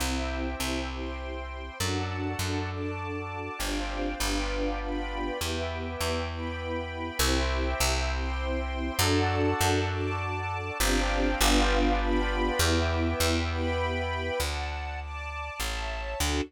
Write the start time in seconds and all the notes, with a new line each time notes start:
0.00 C2 C4 E4 G4 C5 E5 G5
0.60 C2
0.89 C5 G5 C6
1.80 F#2 D4 F#4 A4 D5 F#5 A5
2.39 F#2
2.70 D5 A5 D6
3.59 G1 C4 D4 F4 G4 C5 D5 F5 G5
4.19 G1 B3 D4 F4 G4 B4 D5 F5 G5
4.81 B4 D5 G5 B5
5.39 E2 B3 E4 G4 B4 E5 G5
6.00 E2
6.30 B4 G5 B5
7.19 C2 C4 E4 G4 C5 E5 G5
7.80 C2
8.11 C5 G5 C6
8.99 F#2 D4 F#4 A4 D5 F#5 A5
9.61 F#2
9.89 D5 A5 D6
10.80 G1 C4 D4 F4 G4 C5 D5 F5 G5
11.40 G1 B3 D4 F4 G4 B4 D5 F5 G5
12.00 B4 D5 G5 B5
12.59 E2 B3 E4 G4 B4 E5 G5
13.20 E2
13.50 B4 G5 B5
14.40 D2 D5 F#5 A5
15.00 D5 A5 D6
15.60 A1 C#5 E5 A5
16.20 D2 D4 F#4 A4